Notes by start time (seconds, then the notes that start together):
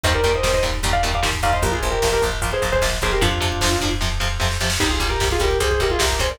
0.03 D#2 A#2 D#3 G3 C5 D#5, kick, closed hi-hat
0.13 A#4 D5, kick
0.24 D#2 A#2 D#3 G3, kick, closed hi-hat
0.34 C5 D#5, kick
0.43 D#2 A#2 D#3 G3, kick, snare
0.54 C5 D#5, kick
0.63 D#2 A#2 D#3 G3, kick, closed hi-hat
0.74 kick
0.83 D#2 A#2 D#3 G3, kick, closed hi-hat
0.93 D5 F5, kick
1.03 D#2 A#2 D#3 G3, kick, closed hi-hat
1.14 D5 F5, kick
1.23 D#2 A#2 D#3 G3, kick, snare
1.33 kick
1.43 D#2 A#2 D#3 G3 D5 F5, kick, closed hi-hat
1.53 C5 D#5, kick
1.62 A#1 A#2 F3 G4 A#4, kick, closed hi-hat
1.72 F4 G#4, kick
1.83 A#1 A#2 F3, kick, closed hi-hat
1.91 G4 A#4, kick
2.02 A#1 A#2 F3, kick, snare
2.12 G4 A#4, kick
2.22 A#1 A#2 F3, kick, closed hi-hat
2.32 kick
2.41 A#1 A#2 F3, kick, closed hi-hat
2.52 G#4 C5, kick
2.62 A#1 A#2 F3, kick, closed hi-hat
2.72 G#4 C5, kick
2.81 A#1 A#2 F3, kick, snare
2.92 kick
3.01 A#1 A#2 F3 G#4 C5, kick, closed hi-hat
3.12 G4 A#4, kick
3.21 F2 C3 F3 D4 F4, kick, closed hi-hat
3.31 kick
3.40 F2 C3 F3, kick, closed hi-hat
3.52 kick
3.61 F2 C3 F3, kick, snare
3.71 kick
3.81 F2 C3 F3, kick, closed hi-hat
3.91 kick
4.01 F2 C3 F3, kick, snare
4.20 F2 C3 F3, snare
4.40 F2 C3 F3, snare
4.51 snare
4.60 F2 C3 F3, snare
4.70 snare
4.80 C2 C3 G3 D#4 G4, kick, crash
4.90 F4 G#4, kick
5.00 C2 C3 G3, kick, closed hi-hat
5.09 G4 A#4, kick
5.20 C2 C3 G3, kick, snare
5.31 F4 G#4, kick
5.40 C2 C3 G3 G4 A#4, kick, closed hi-hat
5.51 kick
5.60 C2 C3 G3 G#4 C5, kick, closed hi-hat
5.70 G#4 C5, kick
5.80 C2 C3 G3 G4 A#4, kick, closed hi-hat
5.90 F4 G#4, kick
5.99 C2 C3 G3 G4 A#4, kick, snare
6.10 kick
6.19 C2 C3 G3 G#4 C5, kick, closed hi-hat
6.30 A#4 D5, kick